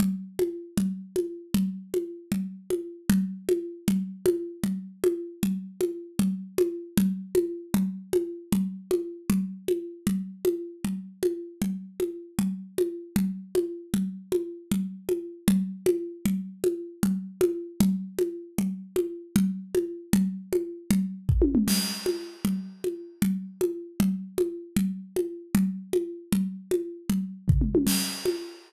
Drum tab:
CC |------|------|------|------|
T1 |------|------|------|------|
T2 |------|------|------|------|
FT |------|------|------|------|
CG |O--o--|O--o--|O--o--|O--o--|
BD |------|------|------|------|

CC |------|------|------|------|
T1 |------|------|------|------|
T2 |------|------|------|------|
FT |------|------|------|------|
CG |O--o--|O--o--|O--o--|O--o--|
BD |------|------|------|------|

CC |------|------|------|------|
T1 |------|------|------|------|
T2 |------|------|------|------|
FT |------|------|------|------|
CG |O--o--|O--o--|O--o--|O--o--|
BD |------|------|------|------|

CC |------|------|------|------|
T1 |------|------|------|------|
T2 |------|------|------|------|
FT |------|------|------|------|
CG |O--o--|O--o--|O--o--|O--o--|
BD |------|------|------|------|

CC |------|------|------|------|
T1 |------|------|------|------|
T2 |------|------|------|------|
FT |------|------|------|------|
CG |O--o--|O--o--|O--o--|O--o--|
BD |------|------|------|------|

CC |------|------|------|------|
T1 |------|------|------|------|
T2 |------|------|------|------|
FT |------|------|------|------|
CG |O--o--|O--o--|O--o--|O--o--|
BD |------|------|------|------|

CC |------|------|------|------|
T1 |------|------|------|----o-|
T2 |------|------|------|-----o|
FT |------|------|------|------|
CG |O--o--|O--o--|O--o--|O-----|
BD |------|------|------|---o--|

CC |x-----|------|------|------|
T1 |------|------|------|------|
T2 |------|------|------|------|
FT |------|------|------|------|
CG |O--o--|O--o--|O--o--|O--o--|
BD |------|------|------|------|

CC |------|------|------|------|
T1 |------|------|------|-----o|
T2 |------|------|------|----o-|
FT |------|------|------|---o--|
CG |O--o--|O--o--|O--o--|O-----|
BD |------|------|------|---o--|

CC |x-----|
T1 |------|
T2 |------|
FT |------|
CG |O--o--|
BD |------|